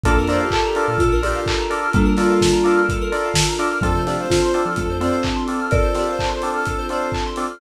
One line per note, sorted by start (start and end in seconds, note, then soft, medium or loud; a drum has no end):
0.03 0.16 A#1 loud
0.03 0.45 A#3 medium
0.03 3.79 D4 medium
0.03 0.13 D4 medium
0.03 0.45 D4 loud
0.03 3.79 F4 medium
0.03 0.13 F4 medium
0.03 0.24 A4 loud
0.03 3.79 A4 medium
0.03 0.13 A4 medium
0.03 0.16 A4 loud
0.03 3.79 A#4 medium
0.03 0.13 A#4 medium
0.03 kick loud
0.03 closed hi-hat loud
0.16 0.38 F2 medium
0.16 0.29 A#4 medium
0.27 0.45 D4 medium
0.27 0.45 F4 medium
0.27 0.45 A4 medium
0.27 0.45 A#4 medium
0.27 0.40 C5 medium
0.27 0.39 D5 loud
0.27 snare medium
0.27 open hi-hat medium
0.40 0.61 G4 medium
0.40 0.51 F5 medium
0.51 0.97 A4 loud
0.51 0.63 A5 loud
0.51 kick medium
0.51 clap loud
0.64 0.86 G4 medium
0.64 0.75 A#5 medium
0.75 0.92 D4 medium
0.75 0.92 F4 medium
0.75 0.92 A4 medium
0.75 0.92 A#4 medium
0.75 0.87 D6 medium
0.75 open hi-hat medium
0.88 1.09 A#2 loud
0.88 1.21 A4 medium
0.88 0.98 F6 medium
0.98 1.20 F4 medium
0.98 1.11 A4 loud
0.98 kick loud
0.98 closed hi-hat loud
1.12 1.33 A#1 loud
1.12 1.22 A#4 medium
1.22 1.39 D4 medium
1.22 1.39 F4 medium
1.22 1.45 G4 medium
1.22 1.85 G4 medium
1.22 1.39 A4 medium
1.22 1.39 A#4 medium
1.22 1.33 D5 medium
1.22 open hi-hat medium
1.35 1.46 F5 medium
1.46 1.58 A5 medium
1.46 kick medium
1.46 clap loud
1.59 1.70 A#5 medium
1.70 1.87 D4 medium
1.70 1.87 F4 medium
1.70 1.87 A4 medium
1.70 1.87 A#4 medium
1.70 1.81 D6 medium
1.70 open hi-hat medium
1.83 1.94 F6 medium
1.93 3.10 G3 loud
1.93 3.10 A#3 loud
1.93 2.14 D4 medium
1.93 2.04 A4 medium
1.93 kick loud
1.93 closed hi-hat loud
2.05 2.16 A#4 medium
2.17 2.34 D4 medium
2.17 2.34 F4 medium
2.17 2.80 F4 medium
2.17 2.34 A4 medium
2.17 2.34 A#4 medium
2.17 2.28 D5 medium
2.17 snare medium
2.17 open hi-hat medium
2.30 2.40 F5 medium
2.41 2.51 A5 medium
2.41 kick medium
2.41 snare loud
2.52 2.63 A#5 medium
2.64 2.81 D4 medium
2.64 2.81 F4 medium
2.64 2.81 A4 medium
2.64 2.81 A#4 medium
2.64 2.74 D6 medium
2.64 open hi-hat medium
2.77 2.87 F6 medium
2.89 3.00 A4 loud
2.89 kick loud
2.89 closed hi-hat loud
3.01 3.12 A#4 medium
3.12 3.28 D4 medium
3.12 3.28 F4 medium
3.12 3.28 A4 medium
3.12 3.28 A#4 medium
3.12 3.23 D5 medium
3.12 open hi-hat medium
3.25 3.36 F5 medium
3.34 3.45 A5 loud
3.34 kick medium
3.34 snare loud
3.48 3.59 A#5 medium
3.59 3.67 D4 medium
3.59 3.67 F4 medium
3.59 3.67 A4 medium
3.59 3.67 A#4 medium
3.59 3.70 D6 medium
3.59 open hi-hat medium
3.71 3.82 F6 medium
3.81 3.94 F2 loud
3.81 4.22 F3 medium
3.81 4.22 A3 medium
3.81 3.91 C4 medium
3.81 7.57 C4 medium
3.81 3.91 D4 medium
3.81 7.57 D4 medium
3.81 3.91 F4 medium
3.81 7.57 F4 medium
3.81 3.93 A4 loud
3.81 3.91 A4 medium
3.81 4.03 A4 loud
3.81 7.57 A4 medium
3.81 kick loud
3.81 closed hi-hat loud
3.94 4.16 C3 loud
3.94 4.05 C5 medium
4.06 4.23 C4 medium
4.06 4.23 D4 medium
4.06 4.23 F4 medium
4.06 4.17 G4 medium
4.06 4.23 A4 medium
4.06 4.17 D5 medium
4.06 snare medium
4.06 open hi-hat medium
4.19 4.40 C5 medium
4.19 4.31 F5 medium
4.30 4.72 F4 medium
4.30 4.40 A5 medium
4.30 kick medium
4.30 snare loud
4.42 4.61 C5 medium
4.42 4.53 C6 medium
4.54 4.71 C4 medium
4.54 4.71 D4 medium
4.54 4.71 F4 medium
4.54 4.71 A4 medium
4.54 4.64 D6 medium
4.54 open hi-hat medium
4.65 4.87 F3 loud
4.65 4.96 A4 medium
4.65 4.76 F6 medium
4.76 4.99 A3 loud
4.76 4.88 A4 medium
4.76 kick medium
4.76 closed hi-hat loud
4.88 5.09 F2 medium
4.88 5.00 C5 medium
5.01 5.59 C4 medium
5.01 5.17 C4 medium
5.01 5.17 D4 medium
5.01 5.17 F4 medium
5.01 5.17 A4 medium
5.01 5.24 C5 medium
5.01 5.12 D5 medium
5.01 open hi-hat medium
5.13 5.23 F5 medium
5.23 5.35 A5 medium
5.23 kick medium
5.23 clap loud
5.36 5.47 C6 medium
5.47 5.65 C4 medium
5.47 5.65 D4 medium
5.47 5.65 F4 medium
5.47 5.65 A4 medium
5.47 5.57 D6 medium
5.47 open hi-hat medium
5.60 5.70 F6 medium
5.71 5.94 A4 loud
5.71 5.83 A4 medium
5.71 6.76 A#4 medium
5.71 6.76 D5 loud
5.71 kick loud
5.71 closed hi-hat loud
5.82 5.93 C5 medium
5.94 6.12 C4 medium
5.94 6.12 D4 medium
5.94 6.12 F4 medium
5.94 6.07 G4 medium
5.94 6.12 A4 medium
5.94 6.07 D5 medium
5.94 snare medium
5.94 open hi-hat medium
6.07 6.28 C5 medium
6.07 6.19 F5 medium
6.19 6.29 A5 medium
6.19 kick medium
6.19 clap loud
6.29 6.50 C5 medium
6.29 6.40 C6 medium
6.42 6.60 C4 medium
6.42 6.60 D4 medium
6.42 6.60 F4 medium
6.42 6.60 A4 medium
6.42 6.53 D6 medium
6.42 open hi-hat medium
6.54 6.85 A4 medium
6.54 6.66 F6 medium
6.65 6.78 A4 medium
6.65 kick medium
6.65 closed hi-hat loud
6.78 6.89 C5 medium
6.89 7.07 C4 medium
6.89 7.07 D4 medium
6.89 7.07 F4 medium
6.89 7.07 A4 medium
6.89 7.10 C5 medium
6.89 7.01 D5 medium
6.89 open hi-hat medium
7.01 7.12 F5 medium
7.12 7.23 A5 medium
7.12 kick medium
7.12 clap loud
7.26 7.37 C6 medium
7.36 7.45 C4 medium
7.36 7.45 D4 medium
7.36 7.45 F4 medium
7.36 7.45 A4 medium
7.36 7.47 D6 medium
7.36 open hi-hat medium
7.51 7.60 F6 medium